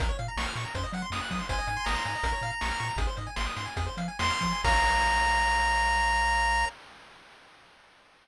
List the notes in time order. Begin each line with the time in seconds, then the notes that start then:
0.00 A#1 A#4, kick, closed hi-hat
0.09 C#5
0.19 A#2 F5, closed hi-hat
0.28 A#5
0.37 A#1 C#6, snare
0.46 F6
0.56 A#2 C#6, snare, closed hi-hat
0.65 A#5
0.75 F#2 C5, kick, closed hi-hat
0.83 D#5
0.93 F#3 F#5, closed hi-hat
1.02 C6
1.10 F#2 D#6, snare
1.21 F#6
1.30 F#3 D#6, kick, open hi-hat
1.39 C6
1.49 G#1 C5 G#5, kick, closed hi-hat
1.58 D#5
1.67 G#2 G#5, closed hi-hat
1.77 C6
1.84 G#1 A#5 D#6, snare
1.95 C6
2.05 G#2 G#5, snare, closed hi-hat
2.15 D#5
2.23 A#1 A#4, kick, closed hi-hat
2.33 C#5
2.41 A#2 F5, closed hi-hat
2.50 A#5
2.61 A#1 C#6, snare
2.71 F6
2.79 A#2 C#6, closed hi-hat
2.89 A#5
2.96 G#1 G#4, kick, closed hi-hat
3.07 C5
3.17 G#2 D#5, closed hi-hat
3.27 G#5
3.36 G#1 C6, snare
3.46 D#6
3.56 G#2 C6, snare, closed hi-hat
3.66 G#5
3.76 F2 G#4, kick, closed hi-hat
3.86 C5
3.97 F3 F5, closed hi-hat
4.08 G#5
4.19 F2 C6, snare
4.30 F6
4.41 F3 C6, kick, closed hi-hat
4.53 G#5
4.64 A#1 A#4 C#5 F5 A#5, kick, crash